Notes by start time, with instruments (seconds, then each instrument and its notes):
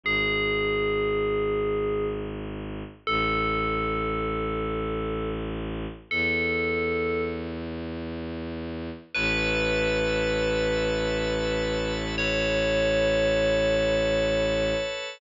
0.03 violin G#1, tubular bells G#4
3.07 violin A1, tubular bells A4
6.11 violin E2, tubular bells A4
9.15 violin A1, tubular bells B4, drawbar organ B4 C#5 E5 A5
12.18 drawbar organ A4 B4 C#5 A5, tubular bells C#5